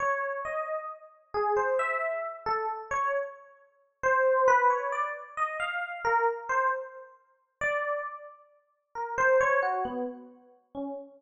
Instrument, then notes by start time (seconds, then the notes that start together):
electric piano 1
0.00 C#5
0.45 D#5
1.34 G#4
1.57 C5
1.79 E5
2.46 A4
2.91 C#5
4.03 C5
4.48 B4
4.70 C#5
4.92 D5
5.37 D#5
5.60 F5
6.05 A#4
6.49 C5
7.61 D5
8.95 A#4
9.18 C5
9.41 C#5
9.62 F#4
9.85 B3
10.75 C#4